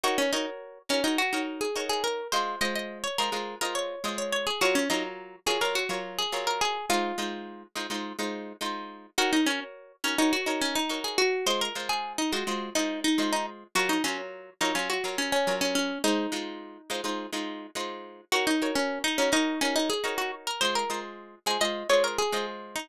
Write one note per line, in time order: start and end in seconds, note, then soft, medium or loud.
0.04 0.26 D#4 medium
0.04 0.18 F#4 medium
0.04 0.26 A#4 loud
0.04 0.26 C#5 medium
0.18 0.32 C#4 medium
0.33 0.46 D#4 medium
0.33 0.79 F#4 medium
0.33 0.79 A#4 medium
0.33 0.79 C#5 medium
0.89 1.04 C#4 medium
0.89 1.01 D#4 medium
0.89 1.01 F#4 medium
0.89 1.01 A#4 medium
0.89 1.01 C#5 medium
1.04 1.18 D#4 medium
1.04 1.27 F#4 medium
1.04 1.27 A#4 medium
1.04 1.27 C#5 medium
1.18 1.42 F#4 medium
1.33 1.67 D#4 medium
1.33 1.67 F#4 medium
1.33 1.67 A#4 medium
1.33 1.67 C#5 medium
1.61 1.85 G#4 medium
1.76 2.21 D#4 medium
1.76 2.21 F#4 medium
1.76 2.21 A#4 medium
1.76 2.21 C#5 medium
1.89 2.03 G#4 medium
2.04 2.28 A#4 medium
2.32 2.56 G#3 medium
2.32 2.56 F4 medium
2.32 2.60 C5 medium
2.32 2.56 D#5 medium
2.61 3.07 G#3 medium
2.61 3.07 F4 medium
2.61 3.07 C5 medium
2.61 2.75 D#5 medium
2.75 2.99 D#5 medium
3.04 3.17 C#5 medium
3.18 3.30 G#3 medium
3.18 3.30 F4 medium
3.18 3.57 A#4 medium
3.18 3.30 C5 medium
3.18 3.30 D#5 medium
3.32 3.55 G#3 medium
3.32 3.55 F4 medium
3.32 3.55 C5 medium
3.32 3.55 D#5 medium
3.61 3.95 G#3 medium
3.61 3.95 F4 medium
3.61 3.75 A#4 medium
3.61 3.95 C5 medium
3.61 3.95 D#5 medium
3.75 4.15 C#5 medium
4.04 4.50 G#3 medium
4.04 4.50 F4 medium
4.04 4.50 C5 medium
4.04 4.50 D#5 medium
4.18 4.32 C#5 medium
4.33 4.46 C#5 medium
4.47 4.60 G#4 medium
4.61 4.84 F#3 loud
4.61 4.84 F4 medium
4.61 4.75 F#4 medium
4.61 4.84 A#4 medium
4.61 4.84 C#5 medium
4.75 4.89 C#4 medium
4.90 5.36 F#3 medium
4.90 5.03 D#4 medium
4.90 5.36 F4 medium
4.90 5.36 A#4 medium
4.90 5.36 C#5 medium
5.46 5.58 F#3 medium
5.46 5.58 F4 medium
5.46 5.60 G#4 medium
5.46 5.58 A#4 medium
5.46 5.58 C#5 medium
5.61 5.84 F#3 medium
5.61 5.84 F4 medium
5.61 5.75 A#4 medium
5.61 5.84 C#5 medium
5.75 6.00 F#4 medium
5.89 6.23 F#3 medium
5.89 6.23 F4 medium
5.89 6.23 A#4 medium
5.89 6.23 C#5 medium
6.19 6.46 G#4 medium
6.32 6.78 F#3 medium
6.32 6.78 F4 medium
6.32 6.78 A#4 medium
6.32 6.78 C#5 medium
6.47 6.61 A#4 medium
6.61 6.86 G#4 medium
6.90 7.13 G#3 medium
6.90 7.13 D#4 medium
6.90 7.62 F4 loud
6.90 7.13 C5 medium
7.18 7.64 G#3 medium
7.18 7.64 D#4 medium
7.18 7.64 F4 medium
7.18 7.64 C5 medium
7.75 7.87 G#3 medium
7.75 7.87 D#4 medium
7.75 7.87 F4 medium
7.75 7.87 C5 medium
7.90 8.13 G#3 medium
7.90 8.13 D#4 medium
7.90 8.13 F4 medium
7.90 8.13 C5 medium
8.19 8.53 G#3 medium
8.19 8.53 D#4 medium
8.19 8.53 F4 medium
8.19 8.53 C5 medium
8.61 9.07 G#3 medium
8.61 9.07 D#4 medium
8.61 9.07 F4 medium
8.61 9.07 C5 medium
9.18 9.41 D#4 medium
9.18 9.32 F#4 loud
9.18 9.41 A#4 loud
9.18 9.41 C#5 medium
9.33 9.46 D#4 medium
9.46 9.60 C#4 medium
9.46 9.93 F#4 medium
9.46 9.93 A#4 medium
9.46 9.93 C#5 medium
10.04 10.18 C#4 medium
10.04 10.15 D#4 medium
10.04 10.15 F#4 medium
10.04 10.15 A#4 medium
10.04 10.15 C#5 medium
10.18 10.32 D#4 medium
10.18 10.41 F#4 medium
10.18 10.41 A#4 medium
10.18 10.41 C#5 medium
10.33 10.61 F#4 medium
10.46 10.81 D#4 medium
10.46 10.81 F#4 medium
10.46 10.81 A#4 medium
10.46 10.81 C#5 medium
10.61 10.75 C#4 medium
10.75 11.00 D#4 medium
10.89 11.35 D#4 medium
10.89 11.35 F#4 medium
10.89 11.35 A#4 medium
10.89 11.35 C#5 medium
11.04 11.18 G#4 medium
11.18 11.46 F#4 medium
11.46 11.69 G#3 medium
11.46 11.69 F4 medium
11.46 11.60 C5 loud
11.46 11.69 D#5 medium
11.61 11.87 A#4 medium
11.75 12.21 G#3 medium
11.75 12.21 F4 medium
11.75 12.21 C5 medium
11.89 12.13 G#4 medium
12.18 12.32 D#4 medium
12.32 12.44 G#3 medium
12.32 12.44 F4 medium
12.32 12.68 F#4 medium
12.32 12.44 C5 medium
12.32 12.44 D#5 medium
12.47 12.70 G#3 medium
12.47 12.70 F4 medium
12.47 12.70 C5 medium
12.47 12.70 D#5 medium
12.75 13.09 G#3 medium
12.75 13.00 D#4 medium
12.75 13.09 F4 medium
12.75 13.09 C5 medium
12.75 13.09 D#5 medium
13.04 13.31 D#4 medium
13.18 13.64 G#3 medium
13.18 13.64 F4 medium
13.18 13.64 C5 medium
13.18 13.64 D#5 medium
13.33 13.46 D#4 medium
13.75 13.98 F#3 loud
13.75 13.98 F4 medium
13.75 13.89 F#4 medium
13.75 13.98 A#4 medium
13.75 13.98 C#5 medium
13.89 14.03 D#4 medium
14.04 14.50 F#3 medium
14.04 14.18 C#4 medium
14.04 14.50 F4 medium
14.04 14.50 A#4 medium
14.04 14.50 C#5 medium
14.61 14.72 F#3 medium
14.61 14.75 D#4 medium
14.61 14.72 F4 medium
14.61 14.72 A#4 medium
14.61 14.72 C#5 medium
14.75 14.98 F#3 medium
14.75 14.89 C#4 medium
14.75 14.98 F4 medium
14.75 14.98 C#5 medium
14.90 15.16 F#4 medium
15.04 15.38 F#3 medium
15.04 15.38 F4 medium
15.04 15.38 A#4 medium
15.04 15.38 C#5 medium
15.18 15.32 C#4 medium
15.32 15.55 C#4 medium
15.47 15.93 F#3 medium
15.47 15.93 F4 medium
15.47 15.93 A#4 medium
15.47 15.93 C#5 medium
15.61 15.75 C#4 medium
15.75 15.99 C#4 medium
16.04 16.27 G#3 medium
16.04 17.28 D#4 loud
16.04 16.27 C5 medium
16.32 16.78 G#3 medium
16.32 16.78 D#4 medium
16.32 16.78 F4 medium
16.32 16.78 C5 medium
16.90 17.01 G#3 medium
16.90 17.01 D#4 medium
16.90 17.01 F4 medium
16.90 17.01 C5 medium
17.04 17.27 G#3 medium
17.04 17.27 D#4 medium
17.04 17.27 F4 medium
17.04 17.27 C5 medium
17.33 17.67 G#3 medium
17.33 17.67 D#4 medium
17.33 17.67 F4 medium
17.33 17.67 C5 medium
17.75 18.21 G#3 medium
17.75 18.21 D#4 medium
17.75 18.21 F4 medium
17.75 18.21 C5 medium
18.32 18.55 D#4 medium
18.32 18.46 F#4 medium
18.32 18.55 A#4 loud
18.32 18.55 C#5 medium
18.47 18.71 D#4 medium
18.62 19.07 F#4 medium
18.62 19.07 A#4 medium
18.62 19.07 C#5 medium
18.75 18.99 C#4 medium
19.04 19.18 D#4 medium
19.18 19.32 C#4 medium
19.18 19.30 D#4 medium
19.18 19.30 F#4 medium
19.18 19.30 A#4 medium
19.18 19.30 C#5 medium
19.32 19.60 D#4 loud
19.32 19.55 F#4 medium
19.32 19.55 A#4 medium
19.32 19.55 C#5 medium
19.61 19.75 C#4 medium
19.61 19.95 D#4 medium
19.61 19.95 F#4 medium
19.61 19.95 A#4 medium
19.61 19.95 C#5 medium
19.76 19.89 D#4 medium
19.90 20.14 G#4 medium
20.04 20.49 D#4 medium
20.04 20.49 F#4 medium
20.04 20.49 A#4 medium
20.04 20.49 C#5 medium
20.18 20.31 F#4 medium
20.47 20.61 A#4 medium
20.61 20.85 G#3 medium
20.61 20.85 F4 medium
20.61 20.74 C5 loud
20.61 20.85 D#5 medium
20.75 21.00 A#4 medium
20.90 21.35 G#3 medium
20.90 21.35 F4 medium
20.90 21.35 C5 medium
21.46 21.58 G#3 medium
21.46 21.58 F4 medium
21.46 21.60 G#4 medium
21.46 21.58 C5 medium
21.46 21.58 D#5 medium
21.61 21.84 G#3 medium
21.61 21.84 F4 medium
21.61 21.84 C5 medium
21.61 21.89 D#5 loud
21.89 22.24 G#3 medium
21.89 22.24 F4 medium
21.89 22.24 C5 medium
21.89 22.03 C#5 medium
21.89 22.24 D#5 medium
22.04 22.18 A#4 medium
22.18 22.46 G#4 medium
22.32 22.78 G#3 medium
22.32 22.78 F4 medium
22.32 22.78 C5 medium
22.32 22.78 D#5 medium
22.76 22.89 D#4 medium